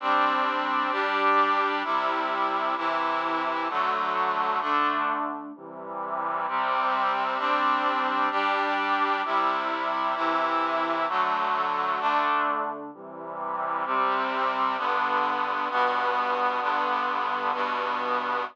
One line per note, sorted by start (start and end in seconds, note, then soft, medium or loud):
0.00 0.91 G3 medium
0.00 0.92 C4 medium
0.00 0.91 D4 medium
0.91 1.83 G3 medium
0.91 1.83 D4 medium
0.91 1.83 G4 medium
1.84 2.75 C3 medium
1.84 2.75 G3 medium
1.84 2.75 E4 medium
2.76 3.68 C3 medium
2.76 3.68 E3 medium
2.76 3.68 E4 medium
3.69 4.60 D3 medium
3.69 4.60 F#3 medium
3.69 4.60 A3 medium
4.61 5.52 D3 medium
4.61 5.52 A3 medium
4.61 5.52 D4 medium
5.55 6.46 C3 medium
5.55 6.46 E3 medium
5.55 6.46 G3 medium
6.47 7.39 C3 loud
6.47 7.37 G3 medium
6.47 7.37 C4 medium
7.38 8.29 G3 medium
7.38 8.29 C4 medium
7.38 8.29 D4 medium
8.31 9.22 G3 medium
8.31 9.22 D4 medium
8.31 9.22 G4 medium
9.25 10.15 C3 medium
9.25 10.16 G3 medium
9.25 10.15 E4 medium
10.15 11.07 C3 medium
10.15 11.07 E3 medium
10.15 11.07 E4 medium
11.08 11.99 D3 medium
11.08 12.00 F#3 medium
11.08 11.99 A3 medium
11.99 12.91 D3 medium
11.99 12.91 A3 medium
11.99 12.91 D4 medium
12.93 13.84 C3 medium
12.93 13.84 E3 medium
12.93 13.84 G3 medium
13.85 14.77 C3 loud
13.85 14.77 G3 medium
13.85 14.77 C4 medium
14.77 15.68 G2 medium
14.77 15.68 D3 medium
14.77 15.68 B3 medium
15.69 16.60 G2 medium
15.69 16.61 B2 medium
15.69 16.60 B3 loud
16.61 17.52 G2 medium
16.61 17.52 D3 medium
16.61 17.52 B3 medium
17.53 18.44 G2 medium
17.53 18.44 B2 medium
17.53 18.44 B3 medium